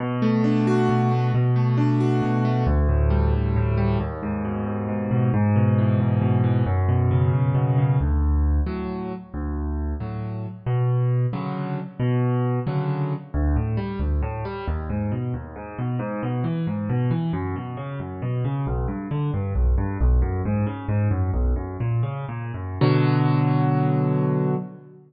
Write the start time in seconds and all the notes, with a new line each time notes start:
0.00 B2
0.22 A3
0.44 D4
0.67 F#4
0.89 B2
1.11 A3
1.34 B2
1.56 A3
1.77 D4
2.00 F#4
2.22 B2
2.45 A3
2.67 D2
2.89 A2
3.10 G3
3.33 D2
3.56 A2
3.77 G3
4.00 D#2
4.23 G#2
4.45 B2
4.66 D#2
4.89 G#2
5.11 B2
5.34 G#2
5.56 B2
5.78 E3
6.00 G#2
6.22 B2
6.44 E3
6.66 F#2
6.89 B2
7.11 C#3
7.33 F#2
7.55 B2
7.78 C#3
8.01 D2
8.66 A2 F#3
9.34 D2
10.00 A2 F#3
10.66 B2
11.33 C#3 D3 F#3
12.00 B2
12.67 C#3 D3 F#3
13.34 D2
13.56 A2
13.77 G3
13.99 D2
14.22 A2
14.45 G3
14.68 D#2
14.90 G#2
15.12 B2
15.34 D#2
15.56 G#2
15.78 B2
15.99 G#2
16.23 B2
16.44 E3
16.67 G#2
16.90 B2
17.11 E3
17.33 F#2
17.56 B2
17.77 C#3
18.00 F#2
18.22 B2
18.45 C#3
18.67 B1
18.88 G2
19.11 D3
19.34 G2
19.55 B1
19.78 G2
20.01 B1
20.22 F#2
20.45 G#2
20.66 C#3
20.89 G#2
21.11 F#2
21.34 B1
21.56 F#2
21.80 A#2
22.03 C#3
22.29 A#2
22.54 F#2
22.81 B2 D3 F#3